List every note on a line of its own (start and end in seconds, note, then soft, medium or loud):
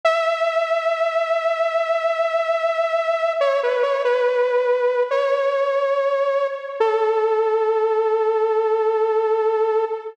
0.05 3.33 E5 loud
3.40 3.61 C#5 loud
3.63 3.83 B4 medium
3.83 4.03 C#5 medium
4.05 5.03 B4 loud
5.11 6.47 C#5 loud
6.80 9.85 A4 loud